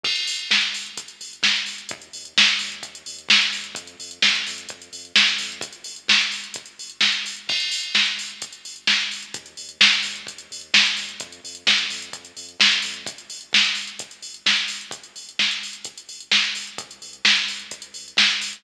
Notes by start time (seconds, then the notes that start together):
0.03 G1, kick, crash
0.16 closed hi-hat
0.27 G1, open hi-hat
0.39 closed hi-hat
0.51 G1, kick, snare
0.61 closed hi-hat
0.73 G1, open hi-hat
0.86 closed hi-hat
0.97 G1, kick, closed hi-hat
1.08 closed hi-hat
1.21 G1, open hi-hat
1.33 closed hi-hat
1.43 G1, kick, snare
1.56 closed hi-hat
1.66 G1, open hi-hat
1.78 closed hi-hat
1.89 D#2, kick, closed hi-hat
2.02 closed hi-hat
2.13 D#2, open hi-hat
2.25 closed hi-hat
2.37 D#2, kick, snare
2.48 closed hi-hat
2.59 D#2, open hi-hat
2.72 closed hi-hat
2.83 D#2, kick, closed hi-hat
2.95 closed hi-hat
3.06 D#2, open hi-hat
3.19 closed hi-hat
3.29 D#2, kick, snare
3.42 closed hi-hat
3.53 D#2, open hi-hat
3.64 closed hi-hat
3.75 F2, kick, closed hi-hat
3.87 closed hi-hat
3.99 F2, open hi-hat
4.11 closed hi-hat
4.22 F2, kick, snare
4.35 closed hi-hat
4.47 F2, open hi-hat
4.58 closed hi-hat
4.69 F2, kick, closed hi-hat
4.82 closed hi-hat
4.93 F2, open hi-hat
5.05 closed hi-hat
5.16 F2, kick, snare
5.27 closed hi-hat
5.38 F2, open hi-hat
5.52 closed hi-hat
5.61 G1, kick, closed hi-hat
5.73 closed hi-hat
5.84 G1, open hi-hat
5.96 closed hi-hat
6.08 G1, kick, snare
6.21 closed hi-hat
6.32 G1, open hi-hat
6.44 closed hi-hat
6.54 G1, kick, closed hi-hat
6.66 closed hi-hat
6.79 G1, open hi-hat
6.90 closed hi-hat
7.01 G1, kick, snare
7.12 closed hi-hat
7.24 G1, open hi-hat
7.36 closed hi-hat
7.47 G1, kick, crash
7.60 closed hi-hat
7.71 G1, open hi-hat
7.83 closed hi-hat
7.95 G1, kick, snare
8.06 closed hi-hat
8.17 G1, open hi-hat
8.30 closed hi-hat
8.42 G1, kick, closed hi-hat
8.53 closed hi-hat
8.65 G1, open hi-hat
8.76 closed hi-hat
8.87 G1, kick, snare
9.01 closed hi-hat
9.11 G1, open hi-hat
9.22 closed hi-hat
9.34 D#2, kick, closed hi-hat
9.46 closed hi-hat
9.57 D#2, open hi-hat
9.69 closed hi-hat
9.81 D#2, kick, snare
9.93 closed hi-hat
10.03 D#2, open hi-hat
10.16 closed hi-hat
10.27 D#2, kick, closed hi-hat
10.38 closed hi-hat
10.51 D#2, open hi-hat
10.61 closed hi-hat
10.74 D#2, kick, snare
10.86 closed hi-hat
10.97 D#2, open hi-hat
11.09 closed hi-hat
11.20 F2, kick, closed hi-hat
11.32 closed hi-hat
11.44 F2, open hi-hat
11.55 closed hi-hat
11.66 F2, kick, snare
11.78 closed hi-hat
11.90 F2, open hi-hat
12.02 closed hi-hat
12.13 F2, kick, closed hi-hat
12.25 closed hi-hat
12.37 F2, open hi-hat
12.49 closed hi-hat
12.60 F2, kick, snare
12.71 closed hi-hat
12.82 F2, open hi-hat
12.94 closed hi-hat
13.06 G1, kick, closed hi-hat
13.18 closed hi-hat
13.30 G1, open hi-hat
13.41 closed hi-hat
13.53 G1, kick, snare
13.64 closed hi-hat
13.75 G1, open hi-hat
13.87 closed hi-hat
13.99 G1, kick, closed hi-hat
14.11 closed hi-hat
14.22 G1, open hi-hat
14.34 closed hi-hat
14.46 G1, kick, snare
14.56 closed hi-hat
14.68 G1, open hi-hat
14.81 closed hi-hat
14.91 G1, kick, closed hi-hat
15.04 closed hi-hat
15.16 G1, open hi-hat
15.29 closed hi-hat
15.39 G1, kick, snare
15.51 closed hi-hat
15.63 G1, open hi-hat
15.73 closed hi-hat
15.84 G1, kick, closed hi-hat
15.98 closed hi-hat
16.09 G1, open hi-hat
16.20 closed hi-hat
16.31 G1, kick, snare
16.44 closed hi-hat
16.55 G1, open hi-hat
16.67 closed hi-hat
16.78 C2, kick, closed hi-hat
16.91 closed hi-hat
17.02 C2, open hi-hat
17.13 closed hi-hat
17.25 C2, kick, snare
17.36 closed hi-hat
17.48 C2, open hi-hat
17.59 closed hi-hat
17.71 C2, kick, closed hi-hat
17.82 closed hi-hat
17.94 C2, open hi-hat
18.08 closed hi-hat
18.17 C2, kick, snare
18.30 closed hi-hat
18.42 C2, open hi-hat
18.53 closed hi-hat